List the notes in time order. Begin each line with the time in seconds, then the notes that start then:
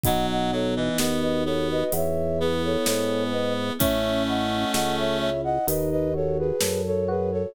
0.04 B1 F#3 B3 D#5 F#5, kick, closed hi-hat
0.31 D#5 F#5
0.52 F#3 D#4 A4 C#5
0.76 E3 B4 D#5
0.98 D#2 B3 F#4 B4 D#5, snare
1.21 B4 D#5
1.45 B3 A4 C#5
1.71 B4 D#5
1.92 E2 B3 C#5 E5, closed hi-hat
2.39 B3 E4 G#4 B4
2.65 A4 C#5
2.86 G#2 G#4 A4 C#5, snare
3.31 B3 B4 D#5
3.79 A1 A3 C#4 C#5 E5, kick, closed hi-hat
4.27 E4 D#5 F#5
4.73 C#2 A4 D#5 F#5, snare
4.98 C#5 E5
5.19 E4 C#5 E5
5.44 D#5 F#5
5.67 D#2 D#4 B4 D#5, closed hi-hat
5.91 B4 D#5
6.14 F#4 A4 C#5
6.39 G#4 B4
6.61 F#2 A4, snare
6.86 A4 C#5
7.08 F#4 G#4 B4
7.31 A4 C#5